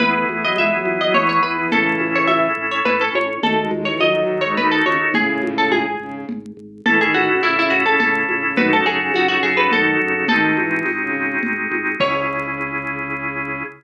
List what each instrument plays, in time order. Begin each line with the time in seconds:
0.00 drawbar organ E2 B3 E4 G#4, violin B3, harpsichord B4, low conga
0.14 violin A3
0.29 drawbar organ E2, violin A3, high conga
0.43 violin F#3, harpsichord D#5
0.56 drawbar organ E2, violin G#3, harpsichord E5, tambourine, high conga
0.72 violin F#3
0.85 drawbar organ E2, high conga
1.00 violin F#3, harpsichord D#5
1.14 drawbar organ E2, violin E3, harpsichord C#5, low conga
1.29 harpsichord C#5
1.43 drawbar organ E2, violin E3, harpsichord B4
1.57 violin E3
1.71 drawbar organ A1 C#4 E4 A4, violin C#3 E3, harpsichord A4, low conga
2.00 drawbar organ A1, high conga
2.15 harpsichord C#5
2.28 drawbar organ A1, harpsichord E5, tambourine, high conga
2.57 drawbar organ A1
2.71 harpsichord C#5
2.85 drawbar organ A1, harpsichord B4, low conga
3.01 harpsichord A4
3.14 drawbar organ A1, harpsichord C#5, high conga
3.42 drawbar organ D#2 D#4 F#4 A4, violin A3, harpsichord A4, low conga
3.58 violin G#3
3.71 drawbar organ D#2, violin G#3, high conga
3.85 violin E3, harpsichord C#5
4.00 drawbar organ D#2, violin F#3, harpsichord D#5, tambourine, high conga
4.14 violin F#3
4.29 drawbar organ D#2
4.41 violin G#3, harpsichord C#5
4.57 drawbar organ D#2, violin D#3, harpsichord B4, low conga
4.72 harpsichord A4
4.85 drawbar organ D#2, violin C#3, harpsichord C#5, high conga
5.01 violin D#3
5.14 drawbar organ G#1, violin A2 C#3, harpsichord G#4, low conga
5.43 drawbar organ G#1, high conga
5.58 harpsichord A4
5.71 drawbar organ G#1, harpsichord G#4, tambourine, high conga
6.00 drawbar organ G#1, violin C#3
6.29 drawbar organ G#1, low conga
6.57 drawbar organ G#1
6.85 drawbar organ A1 C#4 E4 A4, violin E3, harpsichord A4, low conga
7.01 violin D#3, harpsichord G#4
7.14 drawbar organ A1, violin D#3, harpsichord F#4, high conga
7.29 violin C#3
7.42 drawbar organ A1, violin C#3, harpsichord E4, tambourine, high conga
7.58 violin C#3, harpsichord E4
7.70 drawbar organ A1, harpsichord F#4
7.86 violin C#3, harpsichord A4
8.00 drawbar organ A1, violin C#3, harpsichord A4, low conga
8.29 drawbar organ A1, violin C#3, high conga
8.43 violin C#3
8.57 drawbar organ F#2 D#4 F#4 A4, violin D#3, harpsichord B4, low conga
8.72 violin C#3, harpsichord A4
8.86 drawbar organ F#2, violin C#3, harpsichord G#4
8.99 violin C#3
9.14 drawbar organ F#2, violin C#3, harpsichord F#4, tambourine, high conga
9.28 violin C#3, harpsichord F#4
9.43 drawbar organ F#2, harpsichord G#4
9.57 violin C#3, harpsichord B4
9.71 drawbar organ F#2, violin D#3, harpsichord A4, low conga
10.00 drawbar organ F#2, violin C#3
10.15 violin C#3
10.28 drawbar organ G#1 C4 D#4 F#4 G#4, violin D#3, harpsichord A4, low conga
10.57 drawbar organ G#1, violin E3, high conga
10.86 drawbar organ G#1, tambourine, high conga
11.01 violin C#3
11.15 drawbar organ G#1
11.43 drawbar organ G#1, low conga
11.71 drawbar organ G#1, high conga
12.00 drawbar organ C#2 C#4 E4 G#4, violin C#3, harpsichord C#5, kick, crash